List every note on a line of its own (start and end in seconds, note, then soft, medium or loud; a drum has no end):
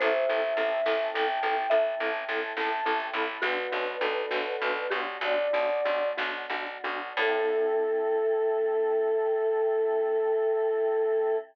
0.00 0.26 A1 medium
0.00 0.11 C4 loud
0.00 3.39 C4 medium
0.00 0.11 E4 loud
0.00 3.39 E4 medium
0.00 0.11 A4 loud
0.00 3.39 A4 medium
0.00 1.33 C5 loud
0.00 1.07 E5 medium
0.00 kick loud
0.00 closed hi-hat loud
0.29 0.54 A1 medium
0.29 0.40 C4 medium
0.29 0.40 E4 medium
0.29 0.40 A4 medium
0.42 closed hi-hat medium
0.57 0.81 A1 medium
0.57 0.69 C4 loud
0.57 0.69 E4 medium
0.57 0.69 A4 medium
0.86 1.10 A1 medium
0.86 0.97 C4 medium
0.86 0.97 E4 medium
0.86 0.97 A4 medium
0.86 snare loud
1.14 1.40 A1 medium
1.14 1.26 C4 medium
1.14 1.26 E4 medium
1.14 1.26 A4 loud
1.14 1.69 G5 medium
1.28 closed hi-hat medium
1.43 1.67 A1 medium
1.43 1.54 C4 medium
1.43 1.54 E4 medium
1.43 1.54 A4 medium
1.70 1.95 A1 medium
1.70 1.83 C4 medium
1.70 1.83 E4 medium
1.70 1.83 A4 medium
1.70 3.08 E5 loud
1.70 closed hi-hat loud
2.00 2.25 A1 medium
2.00 2.11 C4 medium
2.00 2.11 E4 loud
2.00 2.11 A4 medium
2.14 closed hi-hat medium
2.29 2.53 A1 medium
2.29 2.40 C4 medium
2.29 2.40 E4 medium
2.29 2.40 A4 medium
2.57 2.81 A1 medium
2.57 2.69 C4 medium
2.57 2.69 E4 medium
2.57 2.69 A4 medium
2.57 3.03 A5 medium
2.57 snare loud
2.85 3.10 A1 medium
2.85 2.97 C4 medium
2.85 2.97 E4 medium
2.85 2.97 A4 medium
3.00 closed hi-hat loud
3.13 3.38 A1 medium
3.13 3.26 C4 loud
3.13 3.26 E4 medium
3.13 3.26 A4 medium
3.13 3.42 B5 medium
3.42 3.67 B1 medium
3.42 3.54 B3 medium
3.42 7.14 B3 medium
3.42 3.54 D4 loud
3.42 7.14 D4 medium
3.42 3.96 F#4 loud
3.42 3.54 F#4 loud
3.42 7.14 F#4 medium
3.42 4.95 B4 medium
3.42 kick loud
3.42 closed hi-hat loud
3.72 3.97 B1 medium
3.72 3.83 B3 medium
3.72 3.83 D4 medium
3.72 3.83 F#4 medium
3.86 closed hi-hat medium
4.01 4.26 B1 medium
4.01 4.13 B3 medium
4.01 4.13 D4 medium
4.01 4.13 F#4 medium
4.01 4.89 A4 medium
4.30 4.57 B1 medium
4.30 4.42 B3 medium
4.30 4.42 D4 loud
4.30 4.42 F#4 medium
4.30 snare loud
4.61 4.87 B1 medium
4.61 4.73 B3 medium
4.61 4.73 D4 medium
4.61 4.73 F#4 loud
4.76 closed hi-hat medium
4.90 5.18 B1 medium
4.90 5.03 B3 medium
4.90 5.03 D4 medium
4.90 5.03 F#4 medium
4.90 6.01 G4 medium
5.21 5.48 B1 medium
5.21 5.35 B3 medium
5.21 5.35 D4 medium
5.21 5.35 F#4 medium
5.21 6.08 D5 medium
5.21 closed hi-hat loud
5.53 5.81 B1 medium
5.53 5.66 B3 medium
5.53 5.66 D4 medium
5.53 5.66 F#4 medium
5.70 closed hi-hat medium
5.85 6.13 B1 medium
5.85 5.98 B3 medium
5.85 5.98 D4 medium
5.85 5.98 F#4 medium
6.17 6.46 B1 medium
6.17 6.30 B3 medium
6.17 6.30 D4 medium
6.17 6.30 F#4 medium
6.17 snare loud
6.50 6.78 B1 medium
6.50 6.64 B3 medium
6.50 6.64 D4 medium
6.50 6.64 F#4 medium
6.67 closed hi-hat medium
6.84 7.13 B1 medium
6.84 6.97 B3 medium
6.84 6.97 D4 loud
6.84 6.97 F#4 loud
7.17 11.35 A2 loud
7.17 11.36 C4 loud
7.17 11.36 E4 loud
7.17 11.36 A4 medium
7.17 11.36 A4 loud
7.17 11.37 A4 loud
7.17 kick loud
7.17 crash loud